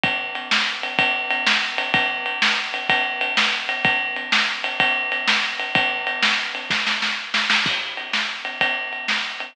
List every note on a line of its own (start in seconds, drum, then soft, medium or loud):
0.04 kick loud
0.04 ride loud
0.35 ride loud
0.51 snare loud
0.83 ride medium
0.99 kick loud
0.99 ride loud
1.30 ride loud
1.47 snare loud
1.78 ride loud
1.94 kick loud
1.94 ride loud
2.26 ride medium
2.42 snare loud
2.74 ride medium
2.89 kick loud
2.89 ride loud
3.21 ride loud
3.37 snare loud
3.69 ride loud
3.85 kick loud
3.85 ride loud
4.16 ride medium
4.32 snare loud
4.64 ride loud
4.80 kick loud
4.80 ride loud
5.12 ride loud
5.28 snare loud
5.60 ride medium
5.75 kick loud
5.75 ride loud
6.07 ride loud
6.22 snare loud
6.55 ride medium
6.70 kick loud
6.70 snare loud
6.87 snare loud
7.02 snare loud
7.34 snare loud
7.50 snare loud
7.66 kick loud
7.66 crash loud
7.97 ride medium
8.13 snare loud
8.45 ride medium
8.61 kick medium
8.61 ride loud
8.93 ride medium
9.08 snare loud
9.40 ride medium